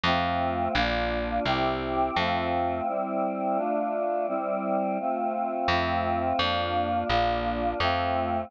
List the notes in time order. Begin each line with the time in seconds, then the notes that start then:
0.03 F2 A3 C4 F4
0.74 A#1 A#3 D4 F4
1.45 C2 C4 E4 G4
2.16 F2 A3 C4 F4
2.87 G3 C4 E4
3.56 A3 D4 F4
4.27 G3 C4 E4
5.00 A3 C4 F4
5.68 F2 A3 C4 F4
6.38 F2 A#3 D4 F4
7.09 A#1 A#3 D4 F4
7.80 F2 A3 C4 F4